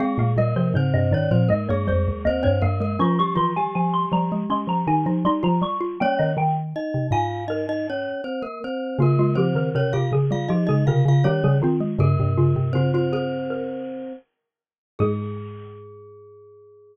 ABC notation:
X:1
M:4/4
L:1/16
Q:1/4=80
K:Ab
V:1 name="Xylophone"
f f e c c e =d2 e _d c2 e d f2 | d' d' c' a a c' b2 c' b a2 c' b d'2 | g e g z3 a2 B4 z4 | F F G B B G A2 G A B2 G A F2 |
G2 F2 F F A2 B6 z2 | A16 |]
V:2 name="Glockenspiel"
[A,A]2 [B,B]2 [Cc]2 [Dd] [Cc] [B,B] [A,A] [A,A]2 [Cc] [Cc] [B,B] [B,B] | [F,F] [G,G] [F,F] [G,G]11 z2 | [Dd]2 z2 [Ee]2 [Ff]2 [Ee] [Ee] [Dd]2 [Cc] [B,B] [Cc]2 | [B,B]2 [Cc]2 [Dd] [Ff] z [Ff] [Ee] [Ee] [Ff] [Ff] [Dd]2 z2 |
[B,B]4 [Cc] [Cc] [Cc]6 z4 | A16 |]
V:3 name="Xylophone"
C B, G, F, D, C, E, F, A, B, G,2 B, C B, A, | D2 =E,2 F,2 G, A, D2 _E E E F2 F | B,10 z6 | B, A, F, E, C, C, D, G, F, A, D,2 G, G, C A, |
D, C, D, C, D,8 z4 | A,16 |]
V:4 name="Xylophone" clef=bass
z B,, B,, C, A,, G,, A,, B,, A,, G,, F,, E,, E,, G,, G,,2 | F,6 F,2 A, F, E, F, G, F, G,2 | G, E, E,2 z C, A,,6 z4 | D,6 D,2 F, D, C, D, E, D, E,2 |
G,, G,,9 z6 | A,,16 |]